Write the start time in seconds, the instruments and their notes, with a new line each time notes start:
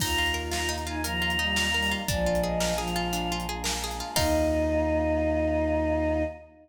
0.00 synth bass 2 D#2, choir aahs A#3 D#4 F4 A#5, orchestral harp D#4, violin F4, kick, crash
0.18 orchestral harp F4
0.26 closed hi-hat
0.34 orchestral harp A#4
0.51 orchestral harp F4, choir aahs A#5, snare
0.69 orchestral harp D#4
0.78 closed hi-hat
0.86 violin D#4, orchestral harp F4, choir aahs G#5
1.04 violin F3, orchestral harp A#4, choir aahs A#5, closed hi-hat
1.22 orchestral harp F4
1.30 closed hi-hat
1.39 violin G3, orchestral harp D#4
1.56 orchestral harp F4, snare
1.74 violin G3, orchestral harp A#4
1.82 open hi-hat
1.91 orchestral harp F4
2.08 synth bass 2 A#1, violin F3, choir aahs G#3 A#3 D4 F4 D5, orchestral harp D4, kick, closed hi-hat
2.26 orchestral harp F4
2.35 closed hi-hat
2.42 orchestral harp G#4, choir aahs D#5
2.60 orchestral harp A#4, snare
2.77 violin F3, orchestral harp G#4, choir aahs F5
2.88 closed hi-hat
2.96 orchestral harp F4
3.13 orchestral harp D4, closed hi-hat
3.32 orchestral harp F4
3.40 closed hi-hat
3.49 orchestral harp G#4
3.64 orchestral harp A#4, snare
3.84 orchestral harp G#4
3.91 closed hi-hat
4.00 orchestral harp F4
4.16 synth bass 2 D#2, choir aahs A#3 D#4 F4 D#5, orchestral harp D#4 F4 A#4, violin D#4, kick, crash